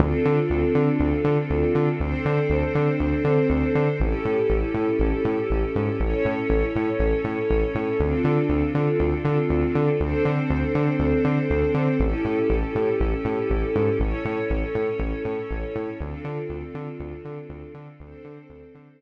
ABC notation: X:1
M:4/4
L:1/8
Q:1/4=120
K:Ddor
V:1 name="String Ensemble 1"
[CDFA]8 | [CDAc]8 | [^CEGA]8 | [^CEA^c]8 |
[CDFA]8 | [CDAc]8 | [^CEGA]8 | [^CEA^c]8 |
[CDFA]8 | [CDAc]8 |]
V:2 name="Synth Bass 1" clef=bass
D,, D, D,, D, D,, D, D,, D, | D,, D, D,, D, D,, D, D,, D, | A,,, A,, A,,, A,, A,,, A,, A,,, _A,, | A,,, A,, A,,, A,, A,,, A,, A,,, A,, |
D,, D, D,, D, D,, D, D,, D, | D,, D, D,, D, D,, D, D,, D, | A,,, A,, A,,, A,, A,,, A,, A,,, _A,, | A,,, A,, A,,, A,, A,,, A,, A,,, A,, |
D,, D, D,, D, D,, D, D,, D, | D,, D, D,, D, D,, z3 |]